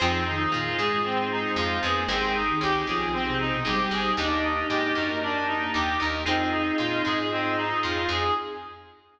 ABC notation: X:1
M:4/4
L:1/16
Q:1/4=115
K:Fm
V:1 name="Clarinet"
C2 E2 F2 A2 C2 E2 F2 A2 | C2 E2 G2 A2 C2 E2 G2 A2 | =D2 E2 G2 B2 D2 E2 G2 B2 | C2 E2 F2 A2 C2 E2 F2 A2 |]
V:2 name="Ocarina"
[F,F]2 [E,E]4 [A,A]2 [A,A]6 [=B,_c] [_B,B] | [A,A]3 [E,E]3 [F,F]3 [C,C]2 [=B,,=B,] [G,G]4 | [Ee]3 [Ee] [Ee]4 [=D=d]2 z4 [Ee]2 | [Ee]12 z4 |]
V:3 name="Acoustic Guitar (steel)"
[EFAc]2 z2 B,2 A,6 F,2 F,2 | [EGAc]2 z2 D2 =B,6 A,2 A,2 | [=DEGB]2 z2 A,2 _G,6 E2 E2 | [CEFA]2 z2 B,2 A,6 F,2 F,2 |]
V:4 name="Drawbar Organ"
[CEFA]4 [CEFA]4 [CEFA]4 [CEFA]4 | [CEGA]4 [CEGA]4 [CEGA]4 [CEGA]4 | [B,=DEG]8 [B,DEG]8 | [CEFA]8 [CEFA]8 |]
V:5 name="Electric Bass (finger)" clef=bass
F,,4 B,,2 A,,6 F,,2 F,,2 | A,,,4 D,,2 =B,,,6 A,,,2 A,,,2 | E,,4 A,,2 _G,,6 E,,2 E,,2 | F,,4 B,,2 A,,6 F,,2 F,,2 |]
V:6 name="Pad 5 (bowed)"
[CEFA]8 [CEAc]8 | [CEGA]8 [CEAc]8 | [B,=DEG]16 | [CEFA]16 |]